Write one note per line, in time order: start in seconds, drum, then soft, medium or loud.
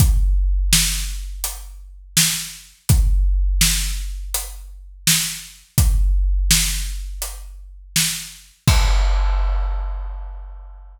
0.00 kick medium
0.00 closed hi-hat medium
0.73 snare loud
1.44 closed hi-hat medium
2.17 snare loud
2.89 kick loud
2.89 closed hi-hat medium
3.61 snare loud
4.34 closed hi-hat medium
5.07 snare loud
5.78 kick loud
5.78 closed hi-hat loud
6.51 snare loud
7.22 closed hi-hat medium
7.96 snare medium
8.68 kick loud
8.68 crash loud